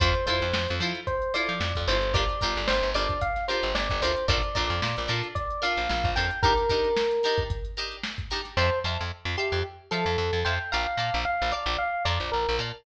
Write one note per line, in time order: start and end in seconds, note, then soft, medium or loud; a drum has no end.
0.00 0.14 F2 medium
0.00 0.10 E4 medium
0.00 0.10 F4 medium
0.00 0.10 A4 loud
0.00 0.10 C5 medium
0.00 0.25 C5 loud
0.00 kick loud
0.00 closed hi-hat medium
0.15 closed hi-hat medium
0.26 0.40 F2 medium
0.26 0.46 E4 medium
0.26 0.46 F4 medium
0.26 0.46 A4 medium
0.26 0.74 C5 medium
0.26 0.46 C5 medium
0.26 kick medium
0.26 closed hi-hat medium
0.41 0.53 F2 medium
0.41 closed hi-hat medium
0.53 0.67 F2 medium
0.53 snare loud
0.68 0.81 F2 medium
0.68 closed hi-hat medium
0.80 0.93 F3 medium
0.80 1.00 E4 medium
0.80 1.00 F4 medium
0.80 1.00 A4 medium
0.80 1.00 C5 medium
0.80 closed hi-hat medium
0.95 closed hi-hat medium
1.07 1.33 C5 loud
1.07 kick medium
1.07 closed hi-hat medium
1.22 closed hi-hat medium
1.34 1.53 E4 medium
1.34 1.53 F4 medium
1.34 1.53 A4 medium
1.34 1.53 C5 medium
1.34 1.80 D5 medium
1.34 closed hi-hat medium
1.48 1.60 F3 medium
1.48 closed hi-hat medium
1.60 1.73 F2 medium
1.60 snare medium
1.75 1.87 F2 medium
1.75 kick medium
1.75 closed hi-hat medium
1.87 2.28 G1 medium
1.87 1.98 E4 medium
1.87 1.98 F4 medium
1.87 1.98 A4 medium
1.87 1.98 C5 medium
1.87 2.13 C5 loud
1.87 closed hi-hat medium
2.02 closed hi-hat medium
2.14 2.24 D4 loud
2.14 2.24 F4 loud
2.14 2.24 G4 medium
2.14 2.24 A#4 medium
2.14 2.66 D5 loud
2.14 kick loud
2.14 closed hi-hat loud
2.29 closed hi-hat medium
2.41 2.56 G1 medium
2.41 2.61 D4 medium
2.41 2.61 F4 medium
2.41 2.61 G4 medium
2.41 2.61 A#4 medium
2.41 kick medium
2.41 closed hi-hat medium
2.56 2.68 G1 medium
2.56 snare soft
2.56 closed hi-hat medium
2.68 2.82 G1 medium
2.68 2.90 C5 loud
2.68 snare loud
2.82 2.94 G1 medium
2.82 closed hi-hat medium
2.94 3.08 G1 medium
2.94 3.14 D4 medium
2.94 3.14 F4 medium
2.94 3.14 G4 medium
2.94 3.14 A#4 medium
2.94 3.19 D5 loud
2.94 closed hi-hat medium
3.09 kick medium
3.09 snare soft
3.09 closed hi-hat medium
3.21 3.44 F5 medium
3.21 kick medium
3.21 closed hi-hat loud
3.36 snare soft
3.36 closed hi-hat medium
3.48 3.68 D4 medium
3.48 3.68 F4 medium
3.48 3.68 G4 medium
3.48 3.68 A#4 medium
3.48 3.73 C5 medium
3.48 closed hi-hat medium
3.63 3.74 G1 medium
3.63 closed hi-hat medium
3.75 3.88 G1 medium
3.75 4.00 D5 loud
3.75 snare loud
3.90 4.02 G1 medium
3.90 kick medium
3.90 snare soft
3.90 closed hi-hat medium
4.02 4.15 D2 medium
4.02 4.12 D4 medium
4.02 4.12 F4 medium
4.02 4.12 G4 medium
4.02 4.12 A#4 medium
4.02 4.26 C5 loud
4.02 closed hi-hat medium
4.16 closed hi-hat medium
4.28 4.42 A#1 medium
4.28 4.38 D4 medium
4.28 4.38 F4 medium
4.28 4.38 A4 loud
4.28 4.38 A#4 loud
4.28 4.53 D5 medium
4.28 kick loud
4.28 closed hi-hat loud
4.43 closed hi-hat medium
4.55 4.70 A#1 medium
4.55 4.74 D4 medium
4.55 4.74 F4 medium
4.55 4.74 A4 medium
4.55 4.74 A#4 medium
4.55 5.06 D5 loud
4.55 kick medium
4.55 closed hi-hat medium
4.70 4.81 F2 medium
4.70 closed hi-hat medium
4.82 4.96 A#2 medium
4.82 snare loud
4.97 5.09 A#1 medium
4.97 snare soft
4.97 closed hi-hat medium
5.08 5.22 A#2 medium
5.08 5.28 D4 medium
5.08 5.28 F4 medium
5.08 5.28 A4 medium
5.08 5.28 A#4 medium
5.08 closed hi-hat medium
5.23 closed hi-hat medium
5.35 5.60 D5 loud
5.35 kick medium
5.35 closed hi-hat loud
5.50 closed hi-hat medium
5.62 5.81 D4 medium
5.62 5.81 F4 medium
5.62 5.81 A4 medium
5.62 5.81 A#4 medium
5.62 6.10 F5 loud
5.62 snare soft
5.62 closed hi-hat medium
5.77 5.88 A#1 medium
5.77 closed hi-hat medium
5.89 6.03 A#1 medium
5.89 snare medium
6.04 6.15 A#1 medium
6.04 kick medium
6.04 closed hi-hat medium
6.16 6.30 F2 medium
6.16 6.26 D4 medium
6.16 6.26 F4 medium
6.16 6.26 A4 medium
6.16 6.26 A#4 medium
6.16 6.40 G5 loud
6.16 closed hi-hat medium
6.31 closed hi-hat medium
6.43 6.53 D4 loud
6.43 6.53 D#4 loud
6.43 6.53 G4 loud
6.43 7.39 A#4 loud
6.43 6.53 A#4 medium
6.43 kick loud
6.43 closed hi-hat medium
6.57 closed hi-hat medium
6.69 6.89 D4 medium
6.69 6.89 D#4 medium
6.69 6.89 G4 medium
6.69 6.89 A#4 medium
6.69 kick medium
6.69 closed hi-hat medium
6.84 closed hi-hat medium
6.97 snare loud
7.11 closed hi-hat medium
7.23 7.43 D4 medium
7.23 7.43 D#4 medium
7.23 7.43 G4 medium
7.23 7.43 A#4 medium
7.23 snare soft
7.23 closed hi-hat medium
7.38 kick medium
7.38 closed hi-hat medium
7.50 kick medium
7.50 closed hi-hat loud
7.65 closed hi-hat medium
7.77 7.97 D4 medium
7.77 7.97 D#4 medium
7.77 7.97 G4 medium
7.77 7.97 A#4 medium
7.77 closed hi-hat medium
7.91 closed hi-hat medium
8.03 snare loud
8.18 kick medium
8.18 closed hi-hat medium
8.30 8.41 D4 medium
8.30 8.41 D#4 medium
8.30 8.41 G4 medium
8.30 8.41 A#4 medium
8.30 closed hi-hat medium
8.45 snare soft
8.45 closed hi-hat medium
8.57 8.70 F2 medium
8.57 8.79 C5 loud
8.57 8.67 E5 medium
8.57 8.67 F5 medium
8.57 8.67 A5 medium
8.57 8.67 C6 medium
8.84 8.98 F2 medium
8.84 9.04 E5 medium
8.84 9.04 F5 medium
8.84 9.04 A5 medium
8.84 9.04 C6 medium
9.01 9.11 F2 medium
9.25 9.36 F2 medium
9.37 9.60 G4 medium
9.37 9.57 E5 medium
9.37 9.57 F5 medium
9.37 9.57 A5 medium
9.37 9.57 C6 medium
9.52 9.63 F2 medium
9.91 10.05 F3 medium
9.91 10.40 A4 loud
9.91 10.10 E5 medium
9.91 10.10 F5 medium
9.91 10.10 A5 medium
9.91 10.10 C6 medium
10.06 10.17 F2 medium
10.18 10.31 F2 medium
10.33 10.44 F2 medium
10.45 10.59 F2 medium
10.45 10.55 E5 medium
10.45 10.55 F5 medium
10.45 10.71 G5 medium
10.45 10.55 A5 medium
10.45 10.55 C6 medium
10.72 10.87 A#1 medium
10.72 10.82 D5 medium
10.72 11.18 F5 loud
10.72 10.82 F5 medium
10.72 10.82 A5 medium
10.72 10.82 A#5 medium
10.97 11.10 A#2 medium
10.97 11.17 D5 medium
10.97 11.17 F5 medium
10.97 11.17 A5 medium
10.97 11.17 A#5 medium
11.14 11.25 A#1 medium
11.25 11.50 F5 loud
11.42 11.53 A#1 medium
11.52 11.76 D5 loud
11.52 11.71 D5 medium
11.52 11.71 F5 medium
11.52 11.71 A5 medium
11.52 11.71 A#5 medium
11.66 11.77 A#1 medium
11.78 12.03 F5 loud
12.05 12.19 F2 medium
12.05 12.28 D5 medium
12.05 12.25 D5 medium
12.05 12.25 F5 medium
12.05 12.25 A5 medium
12.05 12.25 A#5 medium
12.20 12.31 A#1 medium
12.32 12.46 A#1 medium
12.32 12.56 A#4 medium
12.49 12.59 A#1 medium
12.59 12.72 A#2 medium
12.59 12.69 D5 medium
12.59 12.69 F5 medium
12.59 12.69 A5 medium
12.59 12.69 A#5 medium